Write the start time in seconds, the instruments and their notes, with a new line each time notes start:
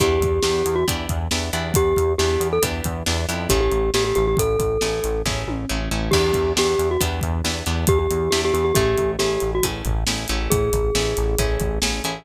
0.00 synth bass 1 E2, pizzicato strings B3 D4 E4 G4, glockenspiel G4, kick, closed hi-hat
0.21 synth bass 1 E2, kick, closed hi-hat
0.43 synth bass 1 E2, pizzicato strings B3 D4 E4 G4, glockenspiel G4, snare
0.66 synth bass 1 E2, closed hi-hat
0.76 glockenspiel F#4
0.88 synth bass 1 E2, pizzicato strings B3 D4 E4 G4, kick, closed hi-hat
1.09 synth bass 1 E2, kick, closed hi-hat
1.31 synth bass 1 E2, pizzicato strings B3 D4 E4 G4, snare
1.53 synth bass 1 E2, pizzicato strings B3 D4 E4 G4, closed hi-hat
1.74 synth bass 1 E2, glockenspiel G4, kick, closed hi-hat
1.96 synth bass 1 E2, kick, closed hi-hat
2.18 synth bass 1 E2, pizzicato strings B3 D4 E4 G4, glockenspiel G4, snare
2.40 synth bass 1 E2, closed hi-hat
2.53 glockenspiel A4
2.62 synth bass 1 E2, pizzicato strings B3 D4 E4 G4, kick, closed hi-hat
2.84 synth bass 1 E2, kick, closed hi-hat
3.06 synth bass 1 E2, pizzicato strings B3 D4 E4 G4, snare
3.29 synth bass 1 F2, pizzicato strings B3 D4 E4 G4, closed hi-hat
3.49 synth bass 1 A1, pizzicato strings A3 C#4 E4 G#4, glockenspiel G4, kick, closed hi-hat
3.61 glockenspiel G4
3.72 synth bass 1 A1, closed hi-hat
3.94 synth bass 1 A1, pizzicato strings A3 C#4 E4 G#4, glockenspiel G4, snare
4.04 glockenspiel G4
4.15 synth bass 1 A1, glockenspiel G4, closed hi-hat
4.27 glockenspiel G4
4.37 synth bass 1 A1, glockenspiel A4, kick, closed hi-hat
4.59 synth bass 1 A1, kick, closed hi-hat
4.81 synth bass 1 A1, pizzicato strings A3 C#4 E4 G#4, snare
5.04 synth bass 1 A1, closed hi-hat
5.26 synth bass 1 A1, pizzicato strings A3 C#4 E4 G#4, kick, snare
5.47 synth bass 1 A1, high tom
5.69 synth bass 1 A1, pizzicato strings A3 C#4 E4 G#4
5.91 synth bass 1 A1, pizzicato strings A3 C#4 E4 G#4
6.11 synth bass 1 E2, pizzicato strings B3 D4 E4 G4, glockenspiel G4, kick, crash
6.33 synth bass 1 E2, kick, closed hi-hat
6.56 synth bass 1 E2, pizzicato strings B3 D4 E4 G4, glockenspiel G4, snare
6.79 synth bass 1 E2, closed hi-hat
6.91 glockenspiel F#4
7.01 synth bass 1 E2, pizzicato strings B3 D4 E4 G4, kick, closed hi-hat
7.21 synth bass 1 E2, kick, closed hi-hat
7.44 synth bass 1 E2, pizzicato strings B3 D4 E4 G4, snare
7.66 synth bass 1 E2, pizzicato strings B3 D4 E4 G4, closed hi-hat
7.87 synth bass 1 E2, glockenspiel G4, kick, closed hi-hat
7.99 glockenspiel G4
8.11 synth bass 1 E2, closed hi-hat
8.31 synth bass 1 E2, pizzicato strings B3 D4 E4 G4, glockenspiel G4, snare
8.45 glockenspiel G4
8.54 synth bass 1 E2, glockenspiel G4, closed hi-hat
8.65 glockenspiel G4
8.75 synth bass 1 A1, pizzicato strings A3 C#4 E4 G#4, glockenspiel G4, kick, closed hi-hat
8.98 synth bass 1 A1, kick, closed hi-hat
9.19 synth bass 1 A1, pizzicato strings A3 C#4 E4 G#4, glockenspiel G4, snare
9.40 synth bass 1 A1, closed hi-hat
9.55 glockenspiel F#4
9.63 synth bass 1 A1, pizzicato strings A3 C#4 E4 G#4, kick, closed hi-hat
9.85 synth bass 1 A1, kick, closed hi-hat
10.07 synth bass 1 A1, pizzicato strings A3 C#4 E4 G#4, snare
10.28 synth bass 1 A1, pizzicato strings A3 C#4 E4 G#4, closed hi-hat
10.50 synth bass 1 A1, glockenspiel G#4, kick, closed hi-hat
10.73 synth bass 1 A1, kick, closed hi-hat
10.95 synth bass 1 A1, pizzicato strings A3 C#4 E4 G#4, snare
11.17 synth bass 1 A1, closed hi-hat
11.39 synth bass 1 A1, pizzicato strings A3 C#4 E4 G#4, kick, closed hi-hat
11.60 synth bass 1 A1, kick, closed hi-hat
11.82 synth bass 1 A1, pizzicato strings A3 C#4 E4 G#4, snare
12.04 synth bass 1 A1, pizzicato strings A3 C#4 E4 G#4, closed hi-hat